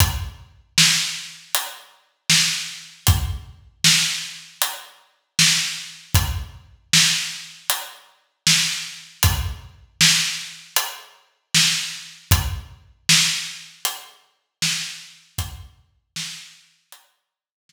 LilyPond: \new DrumStaff \drummode { \time 4/4 \tempo 4 = 78 <hh bd>4 sn4 hh4 sn4 | <hh bd>4 sn4 hh4 sn4 | <hh bd>4 sn4 hh4 sn4 | <hh bd>4 sn4 hh4 sn4 |
<hh bd>4 sn4 hh4 sn4 | <hh bd>4 sn4 hh4 sn4 | }